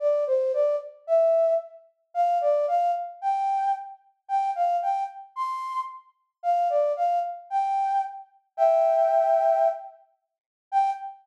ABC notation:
X:1
M:4/4
L:1/8
Q:1/4=112
K:Gdor
V:1 name="Flute"
d c d z e2 z2 | f d f z g2 z2 | g f g z c'2 z2 | f d f z g2 z2 |
[eg]5 z3 | g2 z6 |]